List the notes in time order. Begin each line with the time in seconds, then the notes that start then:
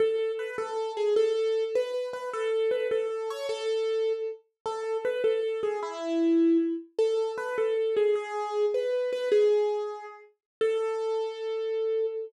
0.00 A4
0.39 B4
0.58 A4
0.97 G#4
1.16 A4
1.75 B4
2.13 B4
2.33 A4
2.71 B4
2.91 A4
3.30 C#5
3.49 A4
4.66 A4
5.05 B4
5.24 A4
5.63 G#4
5.83 E4
6.99 A4
7.38 B4
7.58 A4
7.97 G#4
8.15 G#4
8.74 B4
9.13 B4
9.32 G#4
10.61 A4